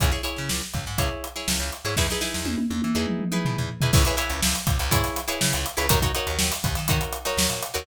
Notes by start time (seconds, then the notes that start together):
0.00 C#2 E4 G#4 C#5, kick, closed hi-hat
0.12 E4 G#4 C#5, snare
0.23 E4 G#4 C#5, closed hi-hat
0.36 C#3, snare
0.49 C#2, snare
0.62 snare
0.74 C#2, kick, snare, closed hi-hat
0.86 G#2, snare
0.98 C#2 E4 G#4 C#5, kick, closed hi-hat
1.24 closed hi-hat
1.36 E4 G#4 C#5, snare
1.48 C#2, snare
1.60 C#2
1.72 closed hi-hat
1.85 G#2 E4 G#4 C#5, snare
1.97 E2 D#4 E4 G#4 B4, kick, snare
2.10 D#4 E4 G#4 B4, snare
2.21 D#4 E4 G#4 B4, snare
2.34 E2, snare
2.45 E2, high tom
2.58 high tom
2.70 E2, high tom
2.82 E3, high tom
2.95 E2 D#4 E4 G#4 B4
3.07 mid tom
3.19 mid tom
3.32 D#4 E4 G#4 B4, mid tom
3.45 B2, floor tom
3.57 E2, floor tom
3.81 E2 D#4 E4 G#4 B4, floor tom
3.93 C#2 E4 G#4 B4 C#5, kick, crash
4.05 E4 G#4 B4 C#5, closed hi-hat
4.17 E4 G#4 B4 C#5, closed hi-hat
4.30 C#2, closed hi-hat
4.42 C#2, snare
4.55 snare, closed hi-hat
4.67 C#2, kick, closed hi-hat
4.79 C#2, closed hi-hat
4.91 G#2 E4 G#4 B4 C#5, kick, closed hi-hat
5.03 snare, closed hi-hat
5.16 snare, closed hi-hat
5.28 E4 G#4 B4 C#5, closed hi-hat
5.41 C#3, snare
5.53 C#2, closed hi-hat
5.66 closed hi-hat
5.77 C#2 E4 G#4 B4 C#5, closed hi-hat
5.89 D#2 D#4 F#4 A#4 C#5, kick, closed hi-hat
6.02 D#4 F#4 A#4 C#5, kick, closed hi-hat
6.15 D#4 F#4 A#4 C#5, closed hi-hat
6.27 D#2, closed hi-hat
6.39 D#2, snare
6.52 snare, closed hi-hat
6.63 D#2, kick, snare, closed hi-hat
6.75 D#3, snare, closed hi-hat
6.88 D#3 D#4 F#4 A#4 C#5, kick, closed hi-hat
7.01 closed hi-hat
7.12 closed hi-hat
7.25 D#4 F#4 A#4 C#5, snare, closed hi-hat
7.37 D#2, snare
7.50 A#2, closed hi-hat
7.62 closed hi-hat
7.74 D#2 D#4 F#4 A#4 C#5, closed hi-hat